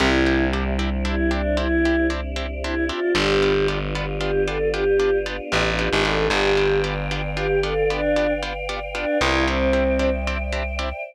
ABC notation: X:1
M:6/8
L:1/16
Q:3/8=76
K:C
V:1 name="Choir Aahs"
E4 z4 E2 D2 | E4 z4 E2 F2 | G4 z4 G2 A2 | G4 z4 G2 A2 |
G4 z4 G2 A2 | D4 z4 D2 E2 | C6 z6 |]
V:2 name="Orchestral Harp"
[CDEG]2 [CDEG]2 [CDEG]2 [CDEG]2 [CDEG]2 [CDEG]2 | [CDEG]2 [CDEG]2 [CDEG]2 [CDEG]2 [CDEG]2 [CDEG]2 | [B,DFG]2 [B,DFG]2 [B,DFG]2 [B,DFG]2 [B,DFG]2 [B,DFG]2 | [B,DFG]2 [B,DFG]2 [B,DFG]2 [B,DFG]2 [B,DFG]2 [B,DFG]2 |
[B,DFG]2 [B,DFG]2 [B,DFG]2 [B,DFG]2 [B,DFG]2 [B,DFG]2 | [B,DFG]2 [B,DFG]2 [B,DFG]2 [B,DFG]2 [B,DFG]2 [B,DFG]2 | [CDEG]2 [CDEG]2 [CDEG]2 [CDEG]2 [CDEG]2 [CDEG]2 |]
V:3 name="Electric Bass (finger)" clef=bass
C,,12- | C,,12 | G,,,12- | G,,,6 A,,,3 ^G,,,3 |
G,,,12- | G,,,10 C,,2- | C,,12 |]
V:4 name="Choir Aahs"
[CDEG]12- | [CDEG]12 | [B,DFG]12- | [B,DFG]12 |
[Bdfg]12- | [Bdfg]12 | [cdeg]12 |]